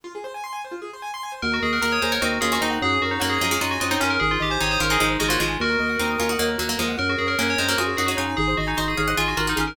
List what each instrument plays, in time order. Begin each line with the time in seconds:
0.04 acoustic grand piano F4
0.15 acoustic grand piano G#4
0.24 acoustic grand piano C5
0.34 acoustic grand piano G#5
0.44 acoustic grand piano C6
0.53 acoustic grand piano G#5
0.64 acoustic grand piano C5
0.72 acoustic grand piano F4
0.82 acoustic grand piano G#4
0.93 acoustic grand piano C5
1.02 acoustic grand piano G#5
1.14 acoustic grand piano C6
1.23 acoustic grand piano G#5
1.32 acoustic grand piano C5
1.42 drawbar organ D#2, acoustic grand piano F#4, tubular bells A#4
1.52 tubular bells F#4, acoustic grand piano A#4
1.62 drawbar organ D#2, tubular bells G#4, acoustic grand piano D#5
1.73 tubular bells A#4, acoustic grand piano F#5
1.82 drawbar organ D#2, pizzicato strings F#4 A#4, tubular bells A#4, acoustic grand piano A#5
1.91 tubular bells C#5, acoustic grand piano D#6
2.02 drawbar organ D#2, pizzicato strings G#4 C5, tubular bells C5, acoustic grand piano A#5
2.12 tubular bells A#4, pizzicato strings A#4 C#5, acoustic grand piano F#5
2.21 drawbar organ D#2, pizzicato strings C4 D#4, tubular bells F#4, acoustic grand piano D#5
2.32 acoustic grand piano A#4
2.41 drawbar organ D#2, pizzicato strings C#4 F4, acoustic grand piano F#4, tubular bells G#4
2.50 pizzicato strings C#4 F4, tubular bells F#4, acoustic grand piano A#4
2.61 drawbar organ D#2, pizzicato strings C4 D#4, tubular bells D#4, acoustic grand piano D#5
2.70 acoustic grand piano F#5
2.82 drawbar organ F#2, acoustic grand piano F#4, tubular bells G#4
2.92 acoustic grand piano G#4
3.01 drawbar organ F#2, tubular bells F#4, acoustic grand piano A#4
3.11 tubular bells D#4, acoustic grand piano C#5
3.20 drawbar organ F#2, pizzicato strings F#3 A#3, tubular bells F#4, acoustic grand piano F#5
3.29 tubular bells G#4, acoustic grand piano G#5
3.41 drawbar organ F#2, pizzicato strings F3 G#3, acoustic grand piano A#5
3.51 pizzicato strings F3 G#3, acoustic grand piano C#6
3.61 drawbar organ F#2, pizzicato strings D#4 F#4, tubular bells F4, acoustic grand piano A#5
3.70 tubular bells F#4, acoustic grand piano G#5
3.80 drawbar organ F#2, pizzicato strings C4 D#4, tubular bells F4, acoustic grand piano F#5
3.91 pizzicato strings C4 D#4, tubular bells D#4, acoustic grand piano C#5
4.00 drawbar organ F#2, tubular bells C#4, pizzicato strings C#4 F4, acoustic grand piano A#4
4.10 acoustic grand piano G#4, tubular bells A#4
4.20 drawbar organ G#1, tubular bells G#4, acoustic grand piano G#4
4.30 tubular bells F4, acoustic grand piano C5
4.40 drawbar organ G#1, tubular bells G4, acoustic grand piano D#5
4.50 tubular bells C5, acoustic grand piano G#5
4.60 drawbar organ G#1, pizzicato strings C4 D#4, tubular bells C#5, acoustic grand piano C6
4.71 tubular bells C5, acoustic grand piano D#6
4.79 drawbar organ G#1, pizzicato strings C#4 F4, tubular bells A#4, acoustic grand piano C6
4.90 pizzicato strings C4 D#4, tubular bells G#4, acoustic grand piano G#5
5.00 drawbar organ G#1, pizzicato strings F3 G#3, tubular bells D#4, acoustic grand piano D#5
5.09 acoustic grand piano C5
5.19 drawbar organ G#1, pizzicato strings F3 G#3, tubular bells F#4, acoustic grand piano G#4
5.28 pizzicato strings F#3 A#3, tubular bells F4, acoustic grand piano C5
5.39 drawbar organ G#1, pizzicato strings F3 G#3, tubular bells F4, acoustic grand piano D#5
5.48 acoustic grand piano G#5
5.60 drawbar organ D#2, acoustic grand piano F#4, tubular bells F#4 A#4
5.70 acoustic grand piano A#4
5.79 drawbar organ D#2, acoustic grand piano D#5
5.89 acoustic grand piano F#5
5.99 drawbar organ D#2, pizzicato strings C4 D#4, acoustic grand piano A#5
6.10 acoustic grand piano D#6
6.18 drawbar organ D#2, pizzicato strings C#4 F4, acoustic grand piano A#5
6.29 pizzicato strings D#4 F#4, acoustic grand piano F#5
6.39 drawbar organ D#2, pizzicato strings F#3 A#3, acoustic grand piano D#5
6.48 acoustic grand piano A#4
6.58 drawbar organ D#2, pizzicato strings F#3 A#3, acoustic grand piano F#4
6.69 pizzicato strings F#3 A#3, acoustic grand piano A#4
6.79 drawbar organ D#2, pizzicato strings F3 G#3, acoustic grand piano D#5
6.89 acoustic grand piano F#5
6.97 drawbar organ F#2, acoustic grand piano F#4, tubular bells A#4
7.09 tubular bells F#4, acoustic grand piano G#4
7.18 drawbar organ F#2, tubular bells G#4, acoustic grand piano A#4
7.27 tubular bells A#4, acoustic grand piano C#5
7.38 drawbar organ F#2, pizzicato strings A#3 C#4, tubular bells A#4, acoustic grand piano F#5
7.48 tubular bells C#5, acoustic grand piano G#5
7.58 drawbar organ F#2, pizzicato strings G#3 C4, tubular bells C5, acoustic grand piano A#5
7.68 pizzicato strings F#3 A#3, tubular bells A#4, acoustic grand piano C#6
7.78 drawbar organ F#2, pizzicato strings F4 G#4, tubular bells F#4, acoustic grand piano F#4
7.87 acoustic grand piano G#4
7.96 drawbar organ F#2, pizzicato strings D#4 F#4, tubular bells G#4, acoustic grand piano A#4
8.06 pizzicato strings D#4 F#4, tubular bells F#4, acoustic grand piano C#5
8.17 drawbar organ F#2, tubular bells D#4, pizzicato strings F4 G#4, acoustic grand piano F#5
8.27 acoustic grand piano G#5
8.37 drawbar organ G#1, tubular bells G#4, acoustic grand piano G#4
8.48 acoustic grand piano C5
8.57 drawbar organ G#1, tubular bells F#4, acoustic grand piano D#5
8.67 tubular bells D#4, acoustic grand piano G#5
8.77 drawbar organ G#1, tubular bells F#4, pizzicato strings C5 D#5, acoustic grand piano C6
8.88 tubular bells G#4, acoustic grand piano D#6
8.97 drawbar organ G#1, acoustic grand piano G#4, pizzicato strings C#5 F5
9.08 acoustic grand piano C5, pizzicato strings D#5 F#5
9.17 drawbar organ G#1, tubular bells F4, pizzicato strings F4 G#4, acoustic grand piano D#5
9.26 tubular bells F#4, acoustic grand piano G#5
9.37 drawbar organ G#1, tubular bells F4, pizzicato strings F#4 A#4, acoustic grand piano C6
9.47 tubular bells D#4, pizzicato strings F#4 A#4, acoustic grand piano D#6
9.56 drawbar organ G#1, tubular bells C#4, pizzicato strings F4 G#4, acoustic grand piano G#4
9.67 tubular bells A#4, acoustic grand piano C5